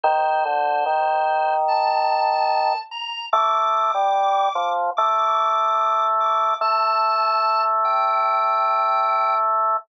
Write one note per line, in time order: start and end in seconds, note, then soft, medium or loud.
0.03 0.44 D#3 loud
0.03 1.54 C5 loud
0.45 0.84 D3 medium
0.86 2.73 D#3 medium
1.68 2.78 A5 medium
2.91 3.26 A#5 medium
3.33 3.91 A3 medium
3.33 4.68 D6 loud
3.94 4.49 G3 medium
4.55 4.90 F3 medium
4.97 6.54 A3 medium
4.97 6.03 D6 loud
6.20 6.54 D6 medium
6.61 9.77 A3 medium
6.61 7.62 A5 medium
7.85 9.35 G5 medium